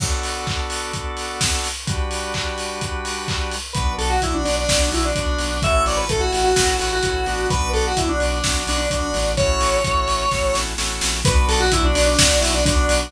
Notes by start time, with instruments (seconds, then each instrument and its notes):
0.00 drawbar organ B3 D4 F#4 A4, kick, crash
0.23 open hi-hat
0.47 kick, clap
0.70 open hi-hat
0.93 kick, closed hi-hat
1.17 open hi-hat
1.41 kick, snare
1.64 open hi-hat
1.87 drawbar organ G3 D4 F#4 B4, kick, closed hi-hat
2.11 open hi-hat
2.34 kick, clap
2.58 open hi-hat
2.81 kick, closed hi-hat
3.05 open hi-hat
3.28 kick, clap
3.51 open hi-hat
3.73 synth bass 1 B1, drawbar organ B3 D4 F#4, lead 1 (square) B4, kick, closed hi-hat
3.98 synth bass 1 B1, lead 1 (square) A4, open hi-hat
4.10 lead 1 (square) F#4
4.22 synth bass 1 B1, drawbar organ B3 D4 F#4, lead 1 (square) E4, kick, closed hi-hat
4.34 lead 1 (square) D4
4.45 synth bass 1 B1, lead 1 (square) D4, open hi-hat
4.56 lead 1 (square) D4
4.69 synth bass 1 B1, drawbar organ B3 D4 F#4, kick, snare
4.92 synth bass 1 B1, lead 1 (square) E4, open hi-hat
5.05 lead 1 (square) D4
5.15 synth bass 1 B1, drawbar organ B3 D4 F#4, lead 1 (square) D4, kick, closed hi-hat
5.38 synth bass 1 B1, open hi-hat
5.62 synth bass 1 A1, drawbar organ A3 C#4 E4 F#4, lead 1 (square) E5, kick, closed hi-hat
5.86 synth bass 1 A1, lead 1 (square) D5, open hi-hat
5.97 lead 1 (square) B4
6.09 synth bass 1 A1, drawbar organ A3 C#4 E4 F#4, lead 1 (square) A4, kick, closed hi-hat
6.20 lead 1 (square) F#4
6.33 synth bass 1 A1, lead 1 (square) F#4, open hi-hat
6.44 lead 1 (square) F#4
6.56 synth bass 1 A1, drawbar organ A3 C#4 E4 F#4, kick, snare
6.79 synth bass 1 A1, lead 1 (square) F#4, open hi-hat
6.93 lead 1 (square) F#4
7.03 synth bass 1 A1, drawbar organ A3 C#4 E4 F#4, lead 1 (square) F#4, kick, closed hi-hat
7.26 synth bass 1 A1, drawbar organ B3 D4 F#4, open hi-hat
7.50 synth bass 1 B1, lead 1 (square) B4, kick, closed hi-hat
7.73 synth bass 1 B1, lead 1 (square) A4, open hi-hat
7.87 lead 1 (square) F#4
7.96 synth bass 1 B1, drawbar organ B3 D4 F#4, lead 1 (square) E4, kick, closed hi-hat
8.09 lead 1 (square) D4
8.19 synth bass 1 B1, lead 1 (square) D4, open hi-hat
8.32 lead 1 (square) D4
8.44 synth bass 1 B1, drawbar organ B3 D4 F#4, kick, snare
8.67 synth bass 1 B1, lead 1 (square) D4, open hi-hat
8.77 lead 1 (square) D4
8.90 synth bass 1 B1, drawbar organ B3 D4 F#4, lead 1 (square) D4, kick, closed hi-hat
9.14 synth bass 1 A1, open hi-hat
9.37 drawbar organ A3 C#4 E4 F#4, lead 1 (square) C#5, kick, closed hi-hat
9.61 synth bass 1 A1, open hi-hat
9.84 synth bass 1 A1, drawbar organ A3 C#4 E4 F#4, kick, closed hi-hat
10.08 synth bass 1 A1, open hi-hat
10.31 synth bass 1 A1, drawbar organ A3 C#4 E4 F#4, kick, snare
10.55 synth bass 1 A1, snare
10.78 synth bass 1 A1, drawbar organ A3 C#4 E4 F#4, snare
11.01 synth bass 1 A#1, snare
11.25 synth bass 1 B1, drawbar organ B3 D4 F#4, lead 1 (square) B4, kick, closed hi-hat
11.48 synth bass 1 B1, lead 1 (square) A4, open hi-hat
11.60 lead 1 (square) F#4
11.72 synth bass 1 B1, drawbar organ B3 D4 F#4, lead 1 (square) E4, kick, closed hi-hat
11.84 lead 1 (square) D4
11.95 synth bass 1 B1, lead 1 (square) D4, open hi-hat
12.06 lead 1 (square) D4
12.19 synth bass 1 B1, drawbar organ B3 D4 F#4, kick, snare
12.41 synth bass 1 B1, lead 1 (square) E4, open hi-hat
12.54 lead 1 (square) D4
12.65 synth bass 1 B1, drawbar organ B3 D4 F#4, lead 1 (square) D4, kick, closed hi-hat
12.89 synth bass 1 B1, open hi-hat